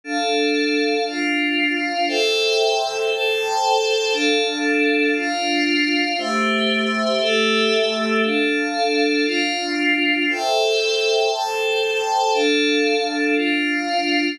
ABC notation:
X:1
M:4/4
L:1/8
Q:1/4=117
K:Am
V:1 name="Pad 5 (bowed)"
[DAf]4 [DFf]4 | [Aceg]4 [Acga]4 | [DAf]4 [DFf]4 | [A,Gce]4 [A,GAe]4 |
[DAf]4 [DFf]4 | [Aceg]4 [Acga]4 | [DAf]4 [DFf]4 |]